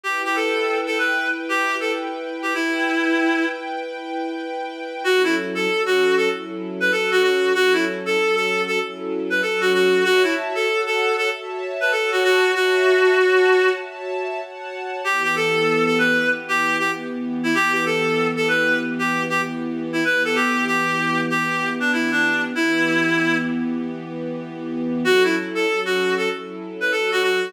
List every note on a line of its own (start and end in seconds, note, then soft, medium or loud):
0.04 2.53 E4 medium
0.04 0.22 G4 medium
0.04 2.53 B4 medium
0.04 2.53 G5 medium
0.25 0.36 G4 medium
0.36 0.78 A4 medium
0.86 0.98 A4 medium
0.98 1.29 B4 medium
1.49 1.76 G4 medium
1.80 1.92 A4 medium
2.42 2.54 G4 medium
2.54 3.45 E4 medium
2.54 5.03 E4 medium
2.54 5.03 B4 medium
2.54 5.03 G5 medium
5.04 5.67 F#3 medium
5.04 5.67 C#4 medium
5.04 5.68 E4 medium
5.04 5.22 F#4 loud
5.04 5.67 A4 medium
5.24 5.36 E4 medium
5.55 5.82 A4 medium
5.68 6.28 F#3 medium
5.68 6.28 C#4 medium
5.68 6.30 F#4 medium
5.68 6.28 A4 medium
5.86 6.15 F#4 medium
6.17 6.29 A4 medium
6.29 6.90 F#3 medium
6.29 6.90 C#4 medium
6.29 6.91 E4 medium
6.29 6.90 A4 medium
6.80 6.92 B4 medium
6.90 7.52 F#3 medium
6.90 7.52 C#4 medium
6.90 7.52 F#4 medium
6.90 7.52 A4 medium
6.90 7.10 A4 medium
7.11 7.22 F#4 medium
7.23 7.53 F#4 medium
7.55 8.17 F#3 medium
7.55 8.17 C#4 medium
7.55 8.17 E4 medium
7.55 7.73 F#4 loud
7.55 8.17 A4 medium
7.73 7.85 E4 medium
8.06 8.35 A4 medium
8.17 8.79 F#3 medium
8.17 8.79 C#4 medium
8.17 8.79 F#4 medium
8.17 8.79 A4 medium
8.36 8.62 A4 medium
8.67 8.79 A4 medium
8.79 9.41 F#3 medium
8.79 9.41 C#4 medium
8.79 9.41 E4 medium
8.79 9.41 A4 medium
9.30 9.41 B4 medium
9.42 10.05 F#3 medium
9.42 10.05 C#4 medium
9.42 10.04 F#4 medium
9.42 9.60 A4 medium
9.42 10.05 A4 medium
9.61 9.72 F#4 medium
9.74 10.04 F#4 medium
10.04 10.66 F#4 medium
10.04 10.22 F#4 loud
10.04 10.66 C#5 medium
10.04 10.66 E5 medium
10.04 10.66 A5 medium
10.23 10.35 E4 medium
10.55 10.81 A4 medium
10.67 11.29 F#4 medium
10.67 11.29 C#5 medium
10.67 11.29 F#5 medium
10.67 11.29 A5 medium
10.86 11.14 A4 medium
11.18 11.29 A4 medium
11.31 11.93 F#4 medium
11.31 11.93 C#5 medium
11.31 11.93 E5 medium
11.31 11.93 A5 medium
11.81 11.92 B4 medium
11.92 12.54 F#4 medium
11.92 12.10 A4 medium
11.92 12.54 C#5 medium
11.92 12.55 F#5 medium
11.92 12.54 A5 medium
12.12 12.23 F#4 medium
12.24 12.52 F#4 loud
12.55 13.15 F#4 medium
12.55 13.69 F#4 medium
12.55 13.15 C#5 medium
12.55 13.17 E5 medium
12.55 13.15 A5 medium
13.16 13.78 F#4 medium
13.16 13.78 C#5 medium
13.16 13.78 F#5 medium
13.16 13.78 A5 medium
13.80 14.40 F#4 medium
13.80 14.40 C#5 medium
13.80 14.42 E5 medium
13.80 14.40 A5 medium
14.40 15.02 F#4 medium
14.40 15.02 C#5 medium
14.40 15.02 F#5 medium
14.40 15.02 A5 medium
15.04 17.53 E3 medium
15.04 17.53 B3 medium
15.04 15.23 G4 medium
15.04 17.53 G4 medium
15.24 15.35 G4 medium
15.36 15.84 A4 medium
15.86 15.98 A4 medium
15.99 16.29 B4 medium
16.48 16.76 G4 loud
16.79 16.91 G4 medium
17.43 17.55 E4 medium
17.53 20.01 E3 medium
17.53 20.01 B3 medium
17.53 20.01 G4 medium
17.53 17.73 G4 loud
17.73 17.85 G4 medium
17.86 18.28 A4 medium
18.36 18.48 A4 medium
18.48 18.78 B4 medium
18.99 19.23 G4 medium
19.30 19.41 G4 medium
19.93 20.04 E4 medium
20.05 22.53 E3 medium
20.05 22.53 B3 medium
20.05 22.53 G4 medium
20.05 20.23 B4 medium
20.25 20.36 A4 medium
20.35 20.65 G4 medium
20.67 21.20 G4 medium
21.30 21.70 G4 medium
21.80 21.92 D4 medium
21.93 22.11 E4 medium
22.11 22.42 D4 medium
22.55 25.04 E3 medium
22.55 25.04 B3 medium
22.55 23.36 E4 loud
22.55 25.04 G4 medium
25.03 25.65 F#3 medium
25.03 25.65 C#4 medium
25.03 25.65 E4 medium
25.03 25.23 F#4 loud
25.03 25.65 A4 medium
25.24 25.35 E4 medium
25.55 25.80 A4 medium
25.66 26.28 F#3 medium
25.66 26.28 C#4 medium
25.66 26.28 F#4 medium
25.66 26.28 A4 medium
25.85 26.14 F#4 medium
26.17 26.29 A4 medium
26.30 26.91 F#3 medium
26.30 26.91 C#4 medium
26.30 26.92 E4 medium
26.30 26.91 A4 medium
26.80 26.92 B4 medium
26.92 27.53 F#3 medium
26.92 27.53 C#4 medium
26.92 27.53 F#4 medium
26.92 27.10 A4 medium
26.92 27.53 A4 medium
27.12 27.22 F#4 loud
27.23 27.52 F#4 medium